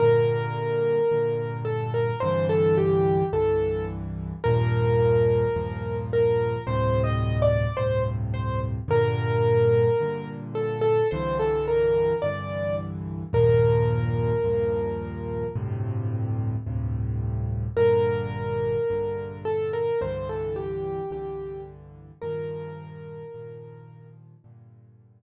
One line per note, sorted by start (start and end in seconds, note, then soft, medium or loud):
0.00 1.00 G2 loud
0.00 1.00 A#2 loud
0.00 1.00 D3 medium
0.00 1.57 A#4 medium
1.12 2.12 G2 medium
1.12 2.12 A#2 medium
1.12 2.12 D3 medium
1.65 1.91 A4 medium
1.94 2.20 A#4 medium
2.20 3.22 C2 loud
2.20 3.22 G2 loud
2.20 3.22 D3 loud
2.20 3.22 E3 loud
2.20 2.47 C5 medium
2.49 2.76 A4 medium
2.78 3.24 G4 medium
3.33 4.33 C2 medium
3.33 4.33 G2 medium
3.33 4.33 D3 medium
3.33 4.33 E3 medium
3.33 3.85 A4 medium
4.44 5.45 D#2 loud
4.44 5.45 G2 loud
4.44 5.45 A#2 loud
4.44 5.45 F3 loud
4.44 5.96 A#4 medium
5.56 6.56 D#2 medium
5.56 6.56 G2 medium
5.56 6.56 A#2 medium
5.56 6.56 F3 medium
6.13 6.62 A#4 medium
6.67 7.67 D2 loud
6.67 7.67 G2 medium
6.67 7.67 A2 loud
6.67 7.67 C3 loud
6.67 7.02 C5 medium
7.04 7.39 D#5 medium
7.42 7.77 D5 medium
7.77 8.78 D2 medium
7.77 8.78 G2 medium
7.77 8.78 A2 medium
7.77 8.78 C3 medium
7.77 8.03 C5 medium
8.34 8.60 C5 medium
8.88 9.88 G2 loud
8.88 9.88 A#2 loud
8.88 9.88 D3 loud
8.88 10.29 A#4 medium
10.00 11.00 G2 medium
10.00 11.00 A#2 medium
10.00 11.00 D3 medium
10.55 10.81 A4 medium
10.81 11.08 A4 medium
11.11 12.12 C2 loud
11.11 12.12 G2 loud
11.11 12.12 D3 medium
11.11 12.12 E3 loud
11.11 11.37 C5 medium
11.40 11.66 A4 medium
11.68 12.15 A#4 medium
12.22 13.23 C2 medium
12.22 13.23 G2 medium
12.22 13.23 D3 medium
12.22 13.23 E3 medium
12.22 12.76 D5 medium
13.33 14.33 D#2 loud
13.33 14.33 G2 loud
13.33 14.33 A#2 loud
13.33 14.33 F3 loud
13.33 15.47 A#4 medium
14.44 15.44 D#2 medium
14.44 15.44 G2 medium
14.44 15.44 A#2 medium
14.44 15.44 F3 medium
15.56 16.56 D2 loud
15.56 16.56 G2 medium
15.56 16.56 A2 loud
15.56 16.56 C3 loud
16.66 17.66 D2 medium
16.66 17.66 G2 medium
16.66 17.66 A2 medium
16.66 17.66 C3 medium
17.77 18.77 A#1 loud
17.77 18.77 G2 loud
17.77 18.77 D3 loud
17.77 19.38 A#4 medium
18.90 19.90 A#1 medium
18.90 19.90 G2 medium
18.90 19.90 D3 medium
19.45 19.72 A4 medium
19.73 20.00 A#4 medium
20.01 21.01 C2 loud
20.01 21.01 G2 loud
20.01 21.01 D3 loud
20.01 21.01 E3 loud
20.01 20.28 C5 medium
20.29 20.56 A4 medium
20.56 21.10 G4 medium
21.11 22.11 C2 medium
21.11 22.11 G2 medium
21.11 22.11 D3 loud
21.11 22.11 E3 medium
21.11 21.61 G4 medium
22.22 23.23 G2 loud
22.22 23.23 A#2 medium
22.22 23.23 D#3 loud
22.22 23.23 F3 loud
22.22 24.07 A#4 medium
23.34 24.34 G2 medium
23.34 24.34 A#2 medium
23.34 24.34 D#3 medium
23.34 24.34 F3 medium
24.44 25.22 G2 loud
24.44 25.22 A#2 loud
24.44 25.22 D3 loud